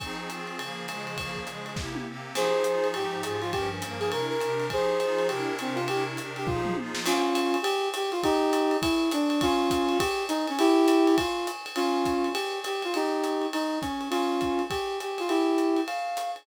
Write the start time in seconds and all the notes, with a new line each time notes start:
0.00 F3 C4 D#4 G#4, kick, ride
0.29 F3 C4 F4 G#4, hi-hat pedal, ride
0.47 ride
0.59 C#3 F3 A#3 G#4, ride
0.88 C#3 F3 G#3 G#4, hi-hat pedal, ride
1.07 ride
1.17 C#3 F3 A#3 G#4, kick, ride
1.36 kick
1.47 C#3 F3 G#3 G#4, hi-hat pedal, ride
1.66 ride
1.76 C3 A#3 E4 G4, kick, snare
1.95 high tom
2.07 C3 A#3 C4 G4
2.34 F3 D#4 G4 G#4 C5, crash, ride
2.64 F3 D#4 F4 G#4, hi-hat pedal
2.84 ride
2.94 G#2 F3 D#4 G4, ride
3.23 G#2 F3 F4 G4 G#4, hi-hat pedal, ride
3.41 F4, ride
3.52 G2 F3 C#4 G4 A#4, kick, ride
3.82 G2 F3 A#3 A#4, hi-hat pedal, ride
4.00 G#4, ride
4.11 C3 D4 E4 A#4, ride
4.30 A#4
4.41 C3 D4 G4 A#4, hi-hat pedal, ride
4.60 ride
4.70 F3 D#4 G4 G#4 C5, kick, ride
5.00 F3 D#4 F4 G#4, hi-hat pedal, ride
5.18 ride
5.28 C3 D4 E4 G4 A#4, ride
5.59 C3 C4 D4 G4 A#4, hi-hat pedal, ride
5.75 F4, ride
5.88 C3 D4 E4 G4 A#4, ride
6.17 C3 D4 G4 A#4, hi-hat pedal, ride
6.36 G4, ride
6.47 F3 D#4 F4 G4 G#4, kick, floor tom
6.65 mid tom
6.76 F3 D#4 F4 G#4, high tom
6.95 snare
7.06 C#4 F4, crash, ride
7.35 hi-hat pedal, ride
7.54 ride
7.62 G4, ride
7.94 G4, hi-hat pedal, ride
8.12 F4, ride
8.23 D#4 G4, kick, ride
8.53 hi-hat pedal, ride
8.71 ride
8.81 E4, kick, ride
9.11 D4, hi-hat pedal, ride
9.30 ride
9.41 C#4 F4, kick, ride
9.70 kick, hi-hat pedal, ride
9.89 ride
9.98 G4, kick, ride
10.29 D#4, hi-hat pedal, ride
10.47 C#4, ride
10.59 E4 G4, ride
10.88 hi-hat pedal, ride
11.07 ride
11.18 F4, kick, ride
11.47 hi-hat pedal, ride
11.66 ride
11.76 C#4 F4, ride
12.05 kick, hi-hat pedal, ride
12.24 ride
12.33 G4, ride
12.64 G4, hi-hat pedal, ride
12.82 F4, ride
12.94 D#4 G4, ride
13.24 hi-hat pedal, ride
13.42 ride
13.53 D#4, ride
13.82 C#4, kick, hi-hat pedal, ride
14.01 ride
14.10 C#4 F4, ride
14.41 kick, hi-hat pedal, ride
14.59 ride
14.70 G4, kick, ride
15.00 G4, hi-hat pedal, ride
15.18 F4, ride
15.29 E4 G4, ride
15.58 hi-hat pedal, ride
15.77 ride
15.87 F5, ride
16.17 hi-hat pedal, ride
16.36 ride